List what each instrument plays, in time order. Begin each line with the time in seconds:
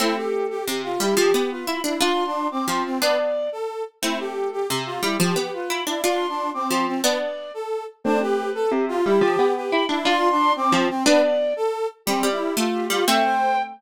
0.00 harpsichord A3 C4, brass section E4, flute C5
0.17 brass section G4, flute A4
0.50 brass section G4
0.67 harpsichord C3, flute G4
0.84 flute F4, brass section F4
1.00 harpsichord G3, brass section E4, flute G4
1.17 harpsichord F3, brass section G4
1.34 harpsichord B3
1.50 brass section F4, flute B4
1.67 harpsichord E4, flute B5
1.84 harpsichord D4, brass section E4
2.00 harpsichord D4 F4, brass section F4, flute C6
2.26 brass section D4
2.51 brass section C4, flute D6
2.68 harpsichord F3, flute C6
2.85 brass section C4
3.02 harpsichord B3 D4, brass section B4, flute D5
3.52 brass section A4
4.02 harpsichord A3 C4, brass section E4, flute C5
4.18 brass section G4, flute A4
4.52 brass section G4
4.68 harpsichord C3, flute G4
4.86 brass section F4, flute F4
5.02 harpsichord G3, brass section E4, flute G4
5.20 harpsichord F3, brass section G4
5.36 harpsichord B3
5.53 brass section F4, flute B4
5.70 harpsichord E4, flute B5
5.87 harpsichord D4, brass section E4
6.04 harpsichord D4 F4, brass section F4, flute C6
6.29 brass section D4
6.54 brass section C4, flute D6
6.70 harpsichord F3, flute C6
6.87 brass section C4
7.04 harpsichord B3 D4, brass section B4, flute D5
7.54 brass section A4
8.04 harpsichord A3 C4, brass section D4, flute C5
8.21 brass section G4, flute B4
8.55 brass section A4
8.71 harpsichord C3, flute G4
8.88 brass section F4, flute F4
9.04 harpsichord G3, brass section E4, flute G4
9.21 harpsichord F3, brass section G4
9.39 harpsichord B3
9.55 brass section G4, flute B4
9.72 harpsichord E4, flute B5
9.89 harpsichord D4, brass section E4
10.05 harpsichord D4 F4, brass section F4, flute C6
10.31 brass section D4
10.56 brass section C4, flute D6
10.72 harpsichord F3, flute C5
10.90 brass section C4
11.05 harpsichord B3 D4, brass section B4, flute D5
11.56 brass section A4
12.06 harpsichord G3, brass section C4, flute G4
12.23 harpsichord G3
12.32 brass section E4
12.57 harpsichord A3, brass section F4
12.73 flute G4
12.90 harpsichord G3, brass section F4
13.07 harpsichord A3 C4, brass section E5, flute G5
13.24 brass section C5